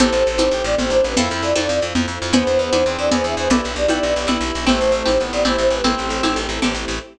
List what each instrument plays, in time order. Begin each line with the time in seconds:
0.00 electric bass (finger) A1, pizzicato strings C4 E4 G4 A4, string ensemble 1 C4 E4 G4 A4, clarinet A4, flute C5, low conga
0.12 electric bass (finger) A1, shaker
0.26 electric bass (finger) A1, shaker
0.38 electric bass (finger) A1, pizzicato strings C4 E4 G4 A4, high conga, shaker
0.51 electric bass (finger) A1, clarinet G4, shaker
0.64 electric bass (finger) A1, flute D5, shaker
0.78 electric bass (finger) A1, clarinet C4, flute C5, low conga, shaker
0.90 electric bass (finger) A1, clarinet D4, flute C5, shaker
1.04 electric bass (finger) A1, flute B4, shaker
1.16 electric bass (finger) F2, string ensemble 1 C4 E4 F4 A4, pizzicato strings C4 E4 F4 A4, clarinet E4, flute A4, low conga, shaker
1.29 electric bass (finger) F2, shaker
1.42 electric bass (finger) F2, flute D5, shaker
1.56 electric bass (finger) F2, pizzicato strings C4 E4 F4 A4, high conga, shaker
1.69 electric bass (finger) F2, shaker
1.81 electric bass (finger) F2, shaker
1.95 electric bass (finger) F2, low conga, shaker
2.07 electric bass (finger) F2, shaker
2.22 electric bass (finger) F2, shaker
2.33 electric bass (finger) E2, string ensemble 1 B3 D4 E4 G#4, clarinet B3, pizzicato strings B4 D5 E5 G#5, flute C5, low conga, shaker
2.46 electric bass (finger) E2, shaker
2.59 electric bass (finger) E2, shaker
2.73 electric bass (finger) E2, pizzicato strings B4 D5 E5 G#5, high conga, shaker
2.86 electric bass (finger) E2, clarinet C4, shaker
2.98 electric bass (finger) E2, flute D5, shaker
3.11 electric bass (finger) E2, clarinet G#4, pizzicato strings B4 D5 E5 G#5, flute C5, low conga, shaker
3.24 electric bass (finger) E2, flute E5, shaker
3.37 electric bass (finger) E2, flute C5, shaker
3.50 electric bass (finger) B1, string ensemble 1 B3 D4 E4 G4, clarinet E4, flute A4, pizzicato strings B4 D5 E5 G5, low conga, shaker
3.64 electric bass (finger) B1, shaker
3.76 electric bass (finger) B1, flute D5, shaker
3.88 electric bass (finger) B1, clarinet E4, pizzicato strings B4 D5 E5 G5, high conga, shaker
4.02 electric bass (finger) B1, shaker
4.15 electric bass (finger) B1, shaker
4.27 electric bass (finger) B1, clarinet E4, pizzicato strings B4 D5 E5 G5, low conga, shaker
4.41 electric bass (finger) B1, shaker
4.54 electric bass (finger) B1, shaker
4.67 electric bass (finger) A1, clarinet A3, string ensemble 1 A3 C4 E4 G4, pizzicato strings C4 E4 G4 A4, flute C5, low conga, shaker
4.81 electric bass (finger) A1, shaker
4.92 electric bass (finger) A1, shaker
5.06 electric bass (finger) A1, pizzicato strings C4 E4 G4 A4, high conga, shaker
5.19 electric bass (finger) A1, clarinet B3, shaker
5.33 electric bass (finger) A1, flute D5, shaker
5.45 electric bass (finger) A1, pizzicato strings C4 E4 G4 A4, clarinet E4, flute C5, low conga, shaker
5.58 electric bass (finger) A1, flute C5, shaker
5.70 electric bass (finger) A1, flute B4, shaker
5.84 electric bass (finger) A1, string ensemble 1 A3 C4 E4 G4, clarinet C4, pizzicato strings C4 E4 G4 A4, flute A4, low conga, shaker
5.97 electric bass (finger) A1, shaker
6.10 electric bass (finger) A1, shaker
6.23 electric bass (finger) A1, pizzicato strings C4 E4 G4 A4, high conga, shaker
6.36 electric bass (finger) A1, shaker
6.49 electric bass (finger) A1, shaker
6.62 electric bass (finger) A1, pizzicato strings C4 E4 G4 A4, low conga, shaker
6.74 electric bass (finger) A1, shaker
6.88 electric bass (finger) A1, shaker